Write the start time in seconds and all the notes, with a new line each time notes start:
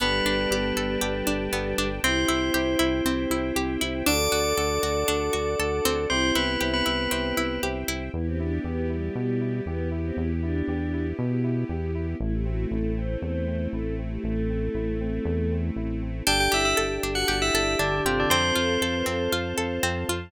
0.00 G1 G3 B3 D4 G4 A4 B4 D5 G5 A5
0.25 G1 D4
0.50 G1 B3 D4 G4 A4
0.76 G1 A4
1.01 G1 B3 D4 G4 A4
1.27 G1 D4
1.52 G1 B3 D4 G4 A4
1.78 G1 D4
2.03 C2 C4 E4 G4 C5 E5 G5
2.28 C2 E4
2.54 C2 C4 E4 G4
2.79 C2 E4
3.05 C2 C4 E4 G4
3.30 C2 E4
3.55 C2 C4 E4 G4
3.81 C2 E4
4.06 D2 D4 F#4 A4 D5 F#5 A5 D6
4.32 D2 F#4
4.58 D2 D4 F#4 A4
4.83 D2 F#4
5.08 D2 D4 F#4 A4
5.33 D2 F#4
5.59 D2 D4 F#4 A4
5.85 D2 C4
6.10 C2 C4 E4 G4 C5 E5 G5
6.35 C2 B3 E4 B4
6.61 C2 C4 E4 G4
6.74 B3 B4
6.86 C2 E4
7.11 C2 C4 E4 G4
7.37 C2 E4
7.63 C2 C4 E4 G4
7.88 C2 E4
8.14 E2 B3 E4 G4
8.26 C4
8.39 D4 E4
8.64 E2 B3 G4
8.89 G3 E4
9.15 B2 G3 B3
9.41 E4
9.66 E2 B3 G4
9.91 E4
10.05 C4
10.17 E2 B3 E4
10.42 D4 E4
10.68 E2 G4
10.93 E4
11.18 B2 B3
11.44 E4
11.69 E2 G4
11.95 E4
12.20 A1 A3 C4 E4
12.33 G4
12.45 C4 F#4
12.71 A1 E4 A4
12.97 C4 C5
13.22 E2 A3 C5
13.47 C4
13.72 A1 E4 A4
13.98 C4
14.11 G4
14.23 A1 A3
14.50 C4
14.75 A1 E4
15.00 C4
15.25 E2 A3
15.51 C4
15.76 A1 E4
16.02 C4
16.27 G1 D4 G4 A4 D5 G5 A5
16.40 G4 G5
16.52 G1 E4 G4 E5
16.65 E4 E5
16.77 G1 A4
17.03 G1 D4
17.15 F#4 F#5
17.28 G1 G4
17.42 E4 E5
17.54 G1 A4
17.79 G1 D3 D4
18.05 G1 C3 C4 F4 G4 A4
18.20 D3 D4
18.30 F2 C4 C5 F5 A5
18.56 F2 F4 A4
18.81 F2 A4
18.94 B4
19.06 F2 C4 A4
19.32 F2 F4
19.58 F2 A4
19.83 F2 C4
20.08 F2 F4